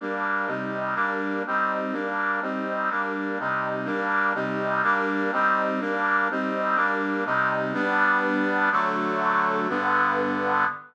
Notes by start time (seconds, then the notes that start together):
0.01 G3 A#3 D4
0.47 C3 G3 D#4
0.95 G3 A#3 D4
1.47 G3 C4 D#4
1.92 G3 A#3 D4
2.42 G3 C4 D#4
2.90 G3 A#3 D4
3.39 C3 G3 D#4
3.85 G3 A#3 D4
4.34 C3 G3 D#4
4.83 G3 A#3 D4
5.32 G3 C4 D#4
5.80 G3 A#3 D4
6.31 G3 C4 D#4
6.76 G3 A#3 D4
7.25 C3 G3 D#4
7.74 G3 B3 D4
8.72 D3 F#3 A3
9.69 G2 D3 B3